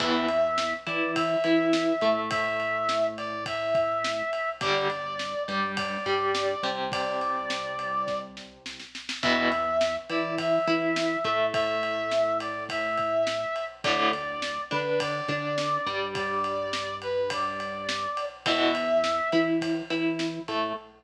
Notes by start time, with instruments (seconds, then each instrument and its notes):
0.00 synth bass 1 E2, overdriven guitar E3 B3, brass section E5, kick, crash
0.28 ride
0.58 snare
0.87 synth bass 1 E3, overdriven guitar E4, brass section D5, ride
1.16 brass section E5, kick, ride
1.44 synth bass 1 E3, overdriven guitar E4, ride
1.73 snare
2.01 synth bass 1 A2, overdriven guitar A3, ride
2.31 brass section E5, kick, ride
2.60 ride
2.89 snare
3.18 brass section D5, ride
3.46 brass section E5, kick, ride
3.75 kick, ride
4.04 snare
4.33 ride
4.61 synth bass 1 G1, overdriven guitar D3 G3, brass section D5, kick, ride
4.90 ride
5.19 snare
5.48 synth bass 1 G2, overdriven guitar G3, brass section D5, ride
5.77 brass section D5, kick, ride
6.06 synth bass 1 G2, overdriven guitar G3, kick, ride
6.35 snare
6.63 synth bass 1 C2, overdriven guitar C3, ride
6.92 brass section D5, kick, ride
7.21 ride
7.50 snare
7.79 ride
8.07 kick, snare
8.37 snare
8.66 snare
8.79 snare
8.95 snare
9.09 snare
9.23 synth bass 1 E2, overdriven guitar B2 E3, brass section E5, kick, crash
9.52 ride
9.81 snare
10.09 synth bass 1 E3, overdriven guitar E4, brass section D5, ride
10.38 brass section E5, kick, ride
10.67 synth bass 1 E3, overdriven guitar E4, ride
10.96 snare
11.24 synth bass 1 A2, overdriven guitar A3, ride
11.54 brass section E5, kick, ride
11.83 ride
12.11 snare
12.40 brass section D5, ride
12.69 brass section E5, kick, ride
12.97 kick, ride
13.27 snare
13.56 ride
13.84 synth bass 1 D2, overdriven guitar A2 D3, brass section D5, kick, ride
14.13 ride
14.42 snare
14.71 synth bass 1 D3, overdriven guitar D4, brass section B4, ride
15.00 brass section D5, kick, ride
15.28 synth bass 1 D3, overdriven guitar D4, kick, ride
15.58 snare
15.86 synth bass 1 G2, overdriven guitar G3, ride
16.15 brass section D5, kick, ride
16.44 ride
16.73 snare
17.02 brass section B4, ride
17.30 brass section D5, kick, ride
17.60 ride
17.89 snare
18.17 ride
18.46 synth bass 1 E2, overdriven guitar B2 E3, brass section E5, kick, ride
18.75 ride
19.04 snare
19.32 synth bass 1 E3, overdriven guitar E4, ride
19.61 kick, ride
19.90 synth bass 1 E3, overdriven guitar E4, ride
20.19 snare
20.48 synth bass 1 A2, overdriven guitar A3, ride